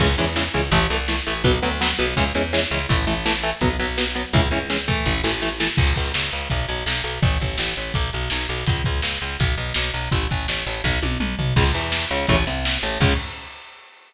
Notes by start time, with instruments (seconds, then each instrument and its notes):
0.00 electric bass (finger) C#2, overdriven guitar C#3 E3 G#3, kick, crash
0.18 electric bass (finger) E2, overdriven guitar C#3 E3 G#3, closed hi-hat
0.36 overdriven guitar C#3 E3 G#3, snare
0.54 electric bass (finger) C#2, overdriven guitar C#3 E3 G#3, closed hi-hat
0.71 electric bass (finger) A1, overdriven guitar E3 A3, kick, closed hi-hat
0.90 electric bass (finger) C2, overdriven guitar E3 A3, closed hi-hat
1.08 overdriven guitar E3 A3, snare
1.27 electric bass (finger) A1, overdriven guitar E3 A3, closed hi-hat
1.44 electric bass (finger) B1, overdriven guitar F#3 B3, kick, closed hi-hat
1.62 electric bass (finger) D2, overdriven guitar F#3 B3, closed hi-hat
1.81 overdriven guitar F#3 B3, snare
1.99 electric bass (finger) B1, overdriven guitar F#3 B3, closed hi-hat
2.17 electric bass (finger) C#2, overdriven guitar E3 G#3 C#4, kick, closed hi-hat
2.35 electric bass (finger) E2, overdriven guitar E3 G#3 C#4, closed hi-hat
2.53 overdriven guitar E3 G#3 C#4, snare
2.71 electric bass (finger) C#2, overdriven guitar E3 G#3 C#4, closed hi-hat
2.89 electric bass (finger) A1, overdriven guitar E3 A3, kick, closed hi-hat
3.07 electric bass (finger) A1, overdriven guitar E3 A3, closed hi-hat
3.26 overdriven guitar E3 A3, snare
3.43 overdriven guitar E3 A3, closed hi-hat
3.61 electric bass (finger) B1, overdriven guitar F#3 B3, kick, closed hi-hat
3.79 electric bass (finger) B1, overdriven guitar F#3 B3, closed hi-hat
3.98 overdriven guitar F#3 B3, snare
4.15 overdriven guitar F#3 B3, closed hi-hat
4.33 electric bass (finger) C#2, overdriven guitar E3 G#3 C#4, kick, closed hi-hat
4.51 electric bass (finger) C#2, overdriven guitar E3 G#3 C#4, closed hi-hat
4.70 overdriven guitar E3 G#3 C#4, snare
4.88 overdriven guitar E3 A3, kick, closed hi-hat
5.05 electric bass (finger) A1, kick, snare
5.24 electric bass (finger) A1, overdriven guitar E3 A3, snare
5.42 overdriven guitar E3 A3, snare
5.60 overdriven guitar E3 A3, snare
5.77 electric bass (finger) C#2, kick, crash
5.88 closed hi-hat
5.96 electric bass (finger) C#2, kick, closed hi-hat
6.05 closed hi-hat
6.14 electric bass (finger) C#2, snare
6.24 closed hi-hat
6.33 electric bass (finger) C#2, closed hi-hat
6.41 closed hi-hat
6.50 electric bass (finger) B1, kick, closed hi-hat
6.59 closed hi-hat
6.69 electric bass (finger) B1, closed hi-hat
6.78 closed hi-hat
6.86 electric bass (finger) B1, snare
6.96 closed hi-hat
7.04 electric bass (finger) B1, closed hi-hat
7.14 closed hi-hat
7.22 electric bass (finger) A1, kick, closed hi-hat
7.33 closed hi-hat
7.40 electric bass (finger) A1, kick, closed hi-hat
7.49 closed hi-hat
7.58 electric bass (finger) A1, snare
7.69 closed hi-hat
7.76 electric bass (finger) A1, closed hi-hat
7.87 closed hi-hat
7.94 electric bass (finger) B1, kick, closed hi-hat
8.05 closed hi-hat
8.13 electric bass (finger) B1, closed hi-hat
8.22 closed hi-hat
8.30 electric bass (finger) B1, snare
8.41 closed hi-hat
8.49 electric bass (finger) B1, closed hi-hat
8.58 closed hi-hat
8.66 electric bass (finger) C#2, kick, closed hi-hat
8.76 closed hi-hat
8.84 electric bass (finger) C#2, kick, closed hi-hat
8.94 closed hi-hat
9.02 electric bass (finger) C#2, snare
9.12 closed hi-hat
9.21 electric bass (finger) C#2, closed hi-hat
9.30 closed hi-hat
9.40 electric bass (finger) B1, kick, closed hi-hat
9.48 closed hi-hat
9.58 electric bass (finger) B1, closed hi-hat
9.66 closed hi-hat
9.74 electric bass (finger) B1, snare
9.84 closed hi-hat
9.94 electric bass (finger) B1, closed hi-hat
10.02 closed hi-hat
10.12 electric bass (finger) A1, kick, closed hi-hat
10.21 closed hi-hat
10.31 electric bass (finger) A1, kick, closed hi-hat
10.41 closed hi-hat
10.48 electric bass (finger) A1, snare
10.57 closed hi-hat
10.66 electric bass (finger) A1, closed hi-hat
10.74 closed hi-hat
10.84 electric bass (finger) B1, kick, snare
11.03 electric bass (finger) B1, high tom
11.20 electric bass (finger) B1, mid tom
11.39 electric bass (finger) B1, floor tom
11.56 electric bass (finger) C#2, overdriven guitar C#3 G#3, kick, crash
11.75 electric bass (finger) E2, overdriven guitar E3, closed hi-hat
11.92 snare
12.11 electric bass (finger) C#2, overdriven guitar C#3, closed hi-hat
12.27 electric bass (finger) A1, overdriven guitar C#3 E3 A3, kick, closed hi-hat
12.46 electric bass (finger) C2, overdriven guitar C3, closed hi-hat
12.65 snare
12.83 electric bass (finger) A1, overdriven guitar A2, closed hi-hat
13.00 electric bass (finger) C#2, overdriven guitar C#3 G#3, kick, crash